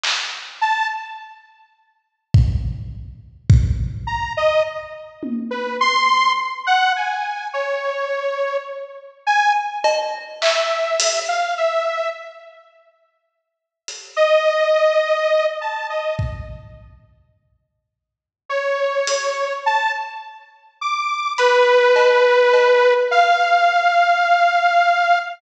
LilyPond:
<<
  \new Staff \with { instrumentName = "Lead 2 (sawtooth)" } { \time 2/4 \tempo 4 = 52 r8 a''16 r4 r16 | r4. ais''16 dis''16 | r8. b'16 c'''8 r16 fis''16 | gis''8 cis''4 r8 |
gis''16 r8. e''8. f''16 | e''8 r4. | r16 dis''4~ dis''16 a''16 dis''16 | r2 |
cis''4 a''16 r8. | d'''8 b'4. | f''2 | }
  \new DrumStaff \with { instrumentName = "Drums" } \drummode { \time 2/4 hc4 r4 | bd4 bd4 | r8 tommh8 r4 | r4 r4 |
r8 cb8 hc8 hh8 | r4 r4 | hh4 r4 | bd4 r4 |
r8 hh8 r4 | r8 hh8 cb8 cb8 | r4 r4 | }
>>